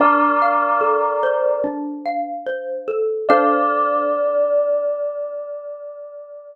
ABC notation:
X:1
M:4/4
L:1/8
Q:1/4=73
K:Dm
V:1 name="Tubular Bells"
[Bd]4 z4 | d8 |]
V:2 name="Xylophone"
D f A c D f c A | [DAcf]8 |]